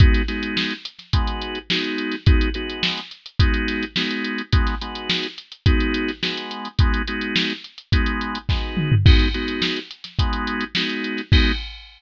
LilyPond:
<<
  \new Staff \with { instrumentName = "Drawbar Organ" } { \time 4/4 \key gis \minor \tempo 4 = 106 <gis b dis' fis'>8 <gis b dis' fis'>4. <gis b dis' fis'>4 <gis b dis' fis'>4 | <gis b dis' fis'>8 <gis b dis' fis'>4. <gis b dis' fis'>4 <gis b dis' fis'>4 | <gis b dis' fis'>8 <gis b dis' fis'>4. <gis b dis' fis'>4 <gis b dis' fis'>4 | <gis b dis' fis'>8 <gis b dis' fis'>4. <gis b dis' fis'>4 <gis b dis' fis'>4 |
<gis b dis' fis'>8 <gis b dis' fis'>4. <gis b dis' fis'>4 <gis b dis' fis'>4 | <gis b dis' fis'>4 r2. | }
  \new DrumStaff \with { instrumentName = "Drums" } \drummode { \time 4/4 <hh bd>16 <hh sn>16 <hh sn>16 hh16 sn16 hh16 hh16 <hh sn>16 <hh bd>16 hh16 hh16 hh16 sn16 hh16 hh16 <hh sn>16 | <hh bd>16 hh16 hh16 hh16 sn16 hh16 hh16 hh16 <hh bd>16 hh16 <hh sn>16 hh16 sn16 hh16 hh16 hh16 | <hh bd>16 <hh sn>16 hh16 hh16 sn16 hh16 hh16 hh16 <hh bd>16 hh16 hh16 <hh sn>16 sn16 hh16 hh16 hh16 | <hh bd>16 hh16 hh16 hh16 sn16 hh16 hh16 hh16 <hh bd>16 hh16 hh16 hh16 <bd sn>8 toml16 tomfh16 |
<cymc bd>16 <hh sn>16 hh16 hh16 sn16 hh16 hh16 <hh sn>16 <hh bd>16 hh16 hh16 hh16 sn16 hh16 hh16 <hh sn>16 | <cymc bd>4 r4 r4 r4 | }
>>